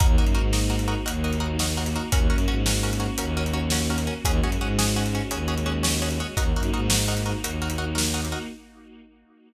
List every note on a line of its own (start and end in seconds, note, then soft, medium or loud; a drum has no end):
0.00 0.16 D#2 medium
0.00 2.10 A#3 medium
0.00 2.10 D#4 medium
0.00 0.07 D#4 medium
0.00 2.10 F#4 medium
0.00 0.07 F#4 medium
0.00 0.07 A#4 medium
0.00 kick loud
0.00 closed hi-hat loud
0.18 0.34 F#2 medium
0.18 0.25 D#4 medium
0.18 0.25 F#4 medium
0.18 0.25 A#4 medium
0.26 closed hi-hat medium
0.35 0.95 G#2 medium
0.35 0.42 D#4 medium
0.35 0.42 F#4 medium
0.35 0.42 A#4 medium
0.53 0.60 D#4 medium
0.53 0.60 F#4 medium
0.53 0.60 A#4 medium
0.53 snare loud
0.70 0.77 D#4 medium
0.70 0.77 F#4 medium
0.70 0.77 A#4 medium
0.79 closed hi-hat medium
0.88 0.95 D#4 medium
0.88 0.95 F#4 medium
0.88 0.95 A#4 medium
1.06 1.97 D#2 medium
1.06 1.13 D#4 medium
1.06 1.13 F#4 medium
1.06 1.13 A#4 medium
1.06 closed hi-hat loud
1.24 1.31 D#4 medium
1.24 1.31 F#4 medium
1.24 1.31 A#4 medium
1.33 closed hi-hat medium
1.40 1.47 D#4 medium
1.40 1.47 F#4 medium
1.40 1.47 A#4 medium
1.59 1.67 D#4 medium
1.59 1.67 F#4 medium
1.59 1.67 A#4 medium
1.59 snare loud
1.77 1.84 D#4 medium
1.77 1.84 F#4 medium
1.77 1.84 A#4 medium
1.86 closed hi-hat medium
1.96 2.03 D#4 medium
1.96 2.03 F#4 medium
1.96 2.03 A#4 medium
2.12 2.28 D#2 medium
2.12 4.23 A#3 medium
2.12 2.19 C#4 medium
2.12 4.23 C#4 medium
2.12 2.19 F#4 medium
2.12 4.23 F#4 medium
2.12 2.19 A#4 medium
2.12 kick loud
2.12 closed hi-hat loud
2.30 2.45 F#2 medium
2.30 2.37 C#4 medium
2.30 2.37 F#4 medium
2.30 2.37 A#4 medium
2.38 closed hi-hat medium
2.48 3.08 G#2 medium
2.48 2.55 C#4 medium
2.48 2.55 F#4 medium
2.48 2.55 A#4 medium
2.66 2.73 C#4 medium
2.66 2.73 F#4 medium
2.66 2.73 A#4 medium
2.66 snare loud
2.83 2.90 C#4 medium
2.83 2.90 F#4 medium
2.83 2.90 A#4 medium
2.93 closed hi-hat medium
3.00 3.07 C#4 medium
3.00 3.07 F#4 medium
3.00 3.07 A#4 medium
3.18 4.08 D#2 medium
3.18 3.26 C#4 medium
3.18 3.26 F#4 medium
3.18 3.26 A#4 medium
3.18 closed hi-hat loud
3.37 3.44 C#4 medium
3.37 3.44 F#4 medium
3.37 3.44 A#4 medium
3.46 closed hi-hat medium
3.53 3.61 C#4 medium
3.53 3.61 F#4 medium
3.53 3.61 A#4 medium
3.70 3.79 C#4 medium
3.70 3.79 F#4 medium
3.70 3.79 A#4 medium
3.70 snare loud
3.90 3.97 C#4 medium
3.90 3.97 F#4 medium
3.90 3.97 A#4 medium
3.98 closed hi-hat medium
4.07 4.14 C#4 medium
4.07 4.14 F#4 medium
4.07 4.14 A#4 medium
4.24 4.40 D#2 loud
4.24 6.35 G#3 medium
4.24 6.35 C#4 medium
4.24 4.32 C#4 medium
4.24 6.35 F#4 medium
4.24 4.32 F#4 medium
4.24 4.32 G#4 loud
4.24 kick loud
4.24 closed hi-hat loud
4.41 4.56 F#2 medium
4.41 4.51 C#4 medium
4.41 4.51 F#4 medium
4.41 4.51 G#4 medium
4.52 closed hi-hat medium
4.60 5.20 G#2 medium
4.60 4.68 C#4 medium
4.60 4.68 F#4 medium
4.60 4.68 G#4 medium
4.79 4.86 C#4 medium
4.79 4.86 F#4 medium
4.79 4.86 G#4 medium
4.79 snare loud
4.96 5.03 C#4 medium
4.96 5.03 F#4 medium
4.96 5.03 G#4 medium
5.06 closed hi-hat medium
5.15 5.22 C#4 medium
5.15 5.22 F#4 medium
5.15 5.22 G#4 medium
5.31 6.21 D#2 medium
5.31 5.38 C#4 medium
5.31 5.38 F#4 medium
5.31 5.38 G#4 medium
5.31 closed hi-hat loud
5.48 5.55 C#4 medium
5.48 5.55 F#4 medium
5.48 5.55 G#4 medium
5.58 closed hi-hat medium
5.66 5.73 C#4 medium
5.66 5.73 F#4 medium
5.66 5.73 G#4 medium
5.83 5.90 C#4 medium
5.83 5.90 F#4 medium
5.83 5.90 G#4 medium
5.83 snare loud
6.02 6.09 C#4 medium
6.02 6.09 F#4 medium
6.02 6.09 G#4 medium
6.11 closed hi-hat medium
6.20 6.27 C#4 medium
6.20 6.27 F#4 medium
6.20 6.27 G#4 medium
6.37 6.52 D#2 medium
6.37 8.47 A#3 medium
6.37 6.44 D#4 medium
6.37 8.47 D#4 medium
6.37 6.44 F#4 medium
6.37 8.47 F#4 medium
6.37 6.44 A#4 medium
6.37 kick loud
6.37 closed hi-hat loud
6.54 6.69 F#2 medium
6.54 6.63 D#4 medium
6.54 6.63 F#4 medium
6.54 6.63 A#4 medium
6.63 closed hi-hat medium
6.73 7.33 G#2 medium
6.73 6.81 D#4 medium
6.73 6.81 F#4 medium
6.73 6.81 A#4 medium
6.90 6.97 D#4 medium
6.90 6.97 F#4 medium
6.90 6.97 A#4 medium
6.90 snare loud
7.08 7.15 D#4 medium
7.08 7.15 F#4 medium
7.08 7.15 A#4 medium
7.17 closed hi-hat medium
7.26 7.33 D#4 medium
7.26 7.33 F#4 medium
7.26 7.33 A#4 medium
7.43 8.33 D#2 medium
7.43 7.51 D#4 medium
7.43 7.51 F#4 medium
7.43 7.51 A#4 medium
7.43 closed hi-hat loud
7.62 7.69 D#4 medium
7.62 7.69 F#4 medium
7.62 7.69 A#4 medium
7.70 closed hi-hat loud
7.78 7.85 D#4 medium
7.78 7.85 F#4 medium
7.78 7.85 A#4 medium
7.95 8.02 D#4 medium
7.95 8.02 F#4 medium
7.95 8.02 A#4 medium
7.95 snare loud
8.14 8.21 D#4 medium
8.14 8.21 F#4 medium
8.14 8.21 A#4 medium
8.25 closed hi-hat medium
8.32 8.39 D#4 medium
8.32 8.39 F#4 medium
8.32 8.39 A#4 medium